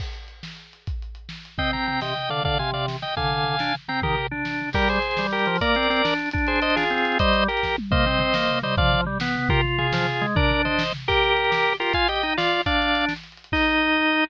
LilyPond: <<
  \new Staff \with { instrumentName = "Drawbar Organ" } { \time 6/8 \key c \minor \tempo 4. = 139 r2. | \time 5/8 r2 r8 | \time 6/8 <ees'' g''>8 <g'' bes''>8 <g'' bes''>8 <ees'' g''>4 <d'' f''>8 | \time 5/8 <d'' f''>8 <f'' aes''>8 <d'' f''>8 r8 <ees'' g''>8 |
\time 6/8 <f'' aes''>2~ <f'' aes''>8 <g'' bes''>8 | \time 5/8 <g' bes'>4 r4. | \time 6/8 \key ees \major <g' bes'>8 <aes' c''>4. <g' bes'>4 | \time 5/8 <bes' d''>2 r8 |
\time 6/8 r8 <aes' c''>8 <c'' ees''>8 <f' aes'>4. | \time 5/8 <c'' ees''>4 <g' bes'>4 r8 | \time 6/8 \key c \minor <c'' ees''>2~ <c'' ees''>8 <c'' ees''>8 | \time 5/8 <d'' f''>4 r4. |
\time 6/8 <g' bes'>8 r8 <f' aes'>2 | \time 5/8 <bes' d''>4 <c'' ees''>4 r8 | \time 6/8 \key ees \major <g' bes'>2~ <g' bes'>8 <g' bes'>8 | \time 5/8 <f'' aes''>8 <ees'' g''>4 <d'' f''>4 |
\time 6/8 <d'' f''>4. r4. | \time 5/8 ees''2~ ees''8 | }
  \new Staff \with { instrumentName = "Drawbar Organ" } { \time 6/8 \key c \minor r2. | \time 5/8 r2 r8 | \time 6/8 c'4. c8 r8 d8 | \time 5/8 d8 c4. r8 |
\time 6/8 d4. d'8 r8 c'8 | \time 5/8 ees8 r8 d'4. | \time 6/8 \key ees \major g4 r8 g4 f8 | \time 5/8 bes8 c'8 c'8 d'4 |
\time 6/8 d'2 c'4 | \time 5/8 g4 r4. | \time 6/8 \key c \minor bes8 c'8 c'8 bes4 g8 | \time 5/8 f4 g8 b4 |
\time 6/8 f'4. f8 r8 aes8 | \time 5/8 d'2 r8 | \time 6/8 \key ees \major g'4 r8 g'4 f'8 | \time 5/8 f'8 g'8 ees'8 f'4 |
\time 6/8 d'2 r4 | \time 5/8 ees'2~ ees'8 | }
  \new DrumStaff \with { instrumentName = "Drums" } \drummode { \time 6/8 <cymc bd>8 hh8 hh8 sn8 hh8 hh8 | \time 5/8 <hh bd>8 hh8 hh8 sn8 hh8 | \time 6/8 <bd tomfh>8 tomfh8 tomfh8 sn8 tomfh8 tomfh8 | \time 5/8 <bd tomfh>8 tomfh8 tomfh8 sn8 tomfh8 |
\time 6/8 <bd tomfh>8 tomfh8 tomfh8 sn8 tomfh8 tomfh8 | \time 5/8 <bd tomfh>8 tomfh8 tomfh8 sn8 tomfh8 | \time 6/8 <cymc bd>16 hh16 hh16 hh16 hh16 hh16 sn16 hh16 hh16 hh16 hh16 hho16 | \time 5/8 <hh bd>16 hh16 hh16 hh16 hh16 hh16 sn16 hh16 hh16 hh16 |
\time 6/8 <hh bd>16 hh16 hh16 hh16 hh16 hh16 sn16 hh16 hh16 hh16 hh16 hh16 | \time 5/8 <hh bd>16 hh16 hh16 hh16 hh16 hh16 <bd sn>8 toml8 | \time 6/8 <bd tomfh>8 tomfh8 tomfh8 sn8 tomfh8 tomfh8 | \time 5/8 <bd tomfh>8 tomfh8 tomfh8 sn8 tomfh8 |
\time 6/8 <bd tomfh>8 tomfh8 tomfh8 sn8 tomfh8 tomfh8 | \time 5/8 <bd tomfh>8 tomfh8 tomfh8 sn8 tomfh8 | \time 6/8 <cymc bd>16 hh16 hh16 hh16 hh16 hh16 sn16 hh16 hh16 hh16 hh16 hho16 | \time 5/8 <hh bd>16 hh16 hh16 hh16 hh16 hh16 sn16 hh16 hh16 hh16 |
\time 6/8 <hh bd>16 hh16 hh16 hh16 hh16 hh16 sn16 hh16 hh16 hh16 hh16 hh16 | \time 5/8 <cymc bd>4. r4 | }
>>